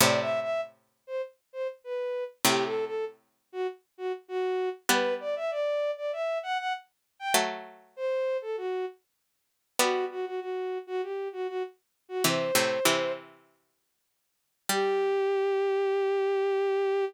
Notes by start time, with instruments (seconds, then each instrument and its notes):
0.00 pizzicato strings A2 C3, violin D5
0.20 violin E5
0.41 violin E5
1.07 violin C5
1.53 violin C5
1.84 violin B4
2.45 pizzicato strings A2 C3, violin G4
2.65 violin A4
2.85 violin A4
3.52 violin F#4
3.98 violin F#4
4.28 violin F#4
4.89 pizzicato strings G3 B3, violin B4
5.20 violin D5
5.36 violin E5
5.51 violin D5
5.97 violin D5
6.13 violin E5
6.43 violin F#5
6.58 violin F#5
7.19 violin G5
7.34 pizzicato strings F#3 A3
7.96 violin C5
8.42 violin A4
8.57 violin F#4
9.79 pizzicato strings G3 B3, violin F#4
10.11 violin F#4
10.26 violin F#4
10.40 violin F#4
10.87 violin F#4
11.02 violin G4
11.33 violin F#4
11.48 violin F#4
12.09 violin F#4
12.24 pizzicato strings C3 E3, violin C5
12.55 pizzicato strings A2 C3
12.85 pizzicato strings C3 E3
14.69 pizzicato strings G3, violin G4